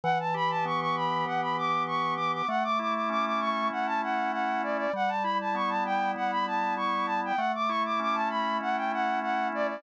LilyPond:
<<
  \new Staff \with { instrumentName = "Flute" } { \time 4/4 \key d \major \tempo 4 = 98 fis''16 a''16 b''16 a''16 cis'''16 cis'''16 b''8 fis''16 b''16 d'''8 cis'''8 d'''16 d'''16 | fis''16 d'''16 d'''16 d'''16 d'''16 d'''16 cis'''8 fis''16 a''16 fis''8 fis''8 d''16 d''16 | fis''16 a''16 b''16 a''16 cis'''16 a''16 g''8 fis''16 b''16 a''8 cis'''8 a''16 g''16 | fis''16 d'''16 cis'''16 d'''16 d'''16 a''16 b''8 fis''16 g''16 fis''8 fis''8 d''16 d''16 | }
  \new Staff \with { instrumentName = "Drawbar Organ" } { \time 4/4 \key d \major e8 g'8 b8 g'8 e8 g'8 g'8 b8 | a8 e'8 cis'8 e'8 a8 e'8 e'8 cis'8 | g8 e'8 b8 e'8 g8 e'8 e'8 b8 | a8 e'8 cis'8 e'8 a8 e'8 e'8 cis'8 | }
>>